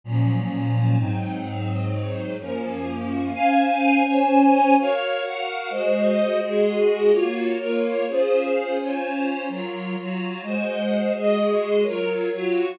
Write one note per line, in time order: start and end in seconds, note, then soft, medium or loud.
0.04 0.98 A#2 medium
0.04 0.98 F3 medium
0.04 0.96 F#3 medium
0.04 0.98 C#4 medium
0.96 2.37 G#2 medium
0.96 2.37 F#3 medium
0.96 2.37 C4 medium
0.96 2.37 D#4 medium
2.39 3.32 F#2 medium
2.39 3.32 F3 medium
2.39 3.32 A#3 medium
2.39 3.32 C#4 medium
3.33 4.03 C#4 medium
3.33 4.03 C5 medium
3.33 4.03 F5 medium
3.33 4.03 G#5 medium
4.05 4.75 C#4 medium
4.05 4.75 C5 medium
4.05 4.75 C#5 medium
4.05 4.75 G#5 medium
4.78 5.23 F#4 medium
4.78 5.23 A#4 medium
4.78 5.25 C#5 medium
4.78 5.23 F5 medium
5.24 5.70 F#4 medium
5.24 5.70 A#4 medium
5.24 5.70 F5 medium
5.24 5.70 F#5 medium
5.70 6.40 G#3 medium
5.70 6.40 F#4 medium
5.70 6.40 C5 medium
5.70 6.40 D#5 medium
6.41 7.11 G#3 medium
6.41 7.11 F#4 medium
6.41 7.11 G#4 medium
6.41 7.11 D#5 medium
7.11 7.58 A#3 medium
7.11 7.58 F4 medium
7.11 7.58 F#4 medium
7.11 7.58 C#5 medium
7.58 8.05 A#3 medium
7.58 8.05 F4 medium
7.58 8.05 A#4 medium
7.58 8.05 C#5 medium
8.08 8.78 C#4 medium
8.08 8.78 F4 medium
8.08 8.78 G#4 medium
8.08 8.78 C5 medium
8.79 9.49 C#4 medium
8.79 9.49 F4 medium
8.79 9.49 C5 medium
8.79 9.49 C#5 medium
9.49 9.96 F#3 medium
9.49 9.96 F4 medium
9.49 9.96 A#4 medium
9.49 9.96 C#5 medium
9.97 10.44 F#3 medium
9.97 10.44 F4 medium
9.97 10.42 F#4 medium
9.97 10.44 C#5 medium
10.42 11.12 G#3 medium
10.42 11.12 F#4 medium
10.42 11.12 C5 medium
10.42 11.12 D#5 medium
11.14 11.84 G#3 medium
11.14 11.84 F#4 medium
11.14 11.84 G#4 medium
11.14 11.84 D#5 medium
11.83 12.30 F#3 medium
11.83 12.30 F4 medium
11.83 12.30 A#4 medium
11.83 12.30 C#5 medium
12.32 12.79 F#3 medium
12.32 12.79 F4 medium
12.32 12.79 F#4 medium
12.32 12.79 C#5 medium